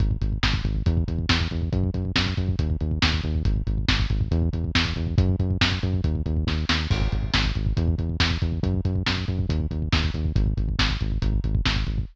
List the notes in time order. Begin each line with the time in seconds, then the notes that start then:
0.00 G#1, kick, closed hi-hat
0.11 kick
0.21 G#1, kick, closed hi-hat
0.32 kick
0.43 G#1, kick, snare
0.54 kick
0.64 G#1, kick, closed hi-hat
0.75 kick
0.86 E2, kick, closed hi-hat
0.97 kick
1.08 E2, kick, closed hi-hat
1.19 kick
1.29 E2, kick, snare
1.40 kick
1.51 E2, kick, closed hi-hat
1.62 kick
1.72 F#2, kick, closed hi-hat
1.84 kick
1.94 F#2, kick, closed hi-hat
2.05 kick
2.16 F#2, kick, snare
2.27 kick
2.37 F#2, kick, closed hi-hat
2.49 kick
2.59 D#2, kick, closed hi-hat
2.70 kick
2.80 D#2, kick, closed hi-hat
2.91 kick
3.02 D#2, kick, snare
3.13 kick
3.23 D#2, kick, closed hi-hat
3.35 kick
3.45 G#1, kick, closed hi-hat
3.56 kick
3.67 G#1, kick, closed hi-hat
3.78 kick
3.88 G#1, kick, snare
3.99 kick
4.10 G#1, kick, closed hi-hat
4.21 kick
4.31 E2, kick, closed hi-hat
4.42 kick
4.53 E2, kick, closed hi-hat
4.64 kick
4.75 E2, kick, snare
4.85 kick
4.96 E2, kick, closed hi-hat
5.07 kick
5.18 F#2, kick, closed hi-hat
5.29 kick
5.39 F#2, kick, closed hi-hat
5.50 kick
5.61 F#2, kick, snare
5.72 kick
5.83 F#2, kick, closed hi-hat
5.94 kick
6.04 D#2, kick, closed hi-hat
6.15 kick
6.26 D#2, kick, closed hi-hat
6.37 kick
6.47 D#2, kick, snare
6.69 D#2, snare
6.91 G#1, kick, crash
7.01 kick
7.12 G#1, kick, closed hi-hat
7.23 kick
7.34 G#1, kick, snare
7.45 kick
7.55 G#1, kick, closed hi-hat
7.66 kick
7.77 E2, kick, closed hi-hat
7.88 kick
7.98 E2, kick, closed hi-hat
8.09 kick
8.20 E2, kick, snare
8.31 kick
8.42 E2, kick, closed hi-hat
8.52 kick
8.63 F#2, kick, closed hi-hat
8.74 kick
8.85 F#2, kick, closed hi-hat
8.96 kick
9.06 F#2, kick, snare
9.17 kick
9.28 F#2, kick, closed hi-hat
9.39 kick
9.49 D#2, kick, closed hi-hat
9.60 kick
9.71 D#2, kick, closed hi-hat
9.82 kick
9.92 D#2, kick, snare
10.04 kick
10.14 D#2, kick, closed hi-hat
10.25 kick
10.36 G#1, kick, closed hi-hat
10.46 kick
10.57 G#1, kick, closed hi-hat
10.69 kick
10.79 G#1, kick, snare
10.90 kick
11.01 G#1, kick, closed hi-hat
11.12 kick
11.22 G#1, kick, closed hi-hat
11.33 kick
11.44 G#1, kick, closed hi-hat
11.55 kick
11.65 G#1, kick, snare
11.76 kick
11.87 G#1, kick, closed hi-hat
11.98 kick